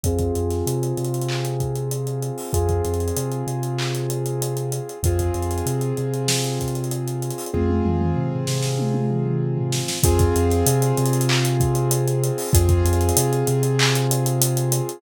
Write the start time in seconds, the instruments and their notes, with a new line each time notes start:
0.04 synth bass 2 F2, acoustic grand piano C4 F4 G#4, kick, closed hi-hat
0.19 kick, closed hi-hat
0.35 synth bass 2 F2, closed hi-hat
0.50 snare, closed hi-hat
0.66 synth bass 2 C3, closed hi-hat
0.83 closed hi-hat
0.97 synth bass 2 C3, closed hi-hat
1.05 closed hi-hat
1.14 closed hi-hat
1.21 closed hi-hat
1.29 clap
1.45 closed hi-hat
1.60 kick, closed hi-hat
1.76 closed hi-hat
1.91 closed hi-hat
2.07 closed hi-hat
2.22 closed hi-hat
2.38 open hi-hat
2.53 synth bass 2 F2, acoustic grand piano C4 F4 G#4, kick, closed hi-hat
2.69 kick, closed hi-hat
2.85 synth bass 2 F2, closed hi-hat
2.94 closed hi-hat
3.00 closed hi-hat
3.08 closed hi-hat
3.17 synth bass 2 C3, closed hi-hat
3.32 closed hi-hat
3.47 synth bass 2 C3, closed hi-hat
3.63 closed hi-hat
3.79 clap
3.95 closed hi-hat
4.10 closed hi-hat
4.26 closed hi-hat
4.42 closed hi-hat
4.57 closed hi-hat
4.72 closed hi-hat
4.89 closed hi-hat
5.03 synth bass 2 F2, acoustic grand piano C4 F4 G#4, kick, closed hi-hat
5.19 kick, closed hi-hat
5.34 synth bass 2 F2, closed hi-hat
5.42 closed hi-hat
5.51 closed hi-hat
5.58 closed hi-hat
5.66 synth bass 2 C3, closed hi-hat
5.81 closed hi-hat
5.97 synth bass 2 C3, closed hi-hat
6.14 closed hi-hat
6.28 snare
6.44 snare, closed hi-hat
6.60 kick, closed hi-hat
6.68 closed hi-hat
6.75 closed hi-hat
6.84 closed hi-hat
6.91 closed hi-hat
7.08 closed hi-hat
7.22 closed hi-hat
7.30 closed hi-hat
7.38 open hi-hat
7.46 closed hi-hat
7.54 synth bass 2 F2, acoustic grand piano C4 F4 G#4, kick, high tom
7.69 high tom
7.85 synth bass 2 F2, mid tom
8.01 mid tom
8.16 synth bass 2 C3, floor tom
8.32 floor tom
8.47 synth bass 2 C3, snare
8.62 snare
8.79 high tom
8.94 high tom
9.11 mid tom
9.26 mid tom
9.58 floor tom
9.72 snare
9.88 snare
10.03 synth bass 2 F2, acoustic grand piano C4 F4 G#4, kick, closed hi-hat
10.19 kick, closed hi-hat
10.36 synth bass 2 F2, closed hi-hat
10.50 snare, closed hi-hat
10.66 synth bass 2 C3, closed hi-hat
10.82 closed hi-hat
10.97 synth bass 2 C3, closed hi-hat
11.06 closed hi-hat
11.13 closed hi-hat
11.21 closed hi-hat
11.29 clap
11.45 closed hi-hat
11.60 kick, closed hi-hat
11.75 closed hi-hat
11.91 closed hi-hat
12.08 closed hi-hat
12.24 closed hi-hat
12.38 open hi-hat
12.53 synth bass 2 F2, acoustic grand piano C4 F4 G#4, kick, closed hi-hat
12.69 kick, closed hi-hat
12.85 synth bass 2 F2, closed hi-hat
12.93 closed hi-hat
13.01 closed hi-hat
13.09 closed hi-hat
13.17 synth bass 2 C3, closed hi-hat
13.33 closed hi-hat
13.47 synth bass 2 C3, closed hi-hat
13.63 closed hi-hat
13.79 clap
13.95 closed hi-hat
14.11 closed hi-hat
14.26 closed hi-hat
14.42 closed hi-hat
14.57 closed hi-hat
14.72 closed hi-hat
14.89 closed hi-hat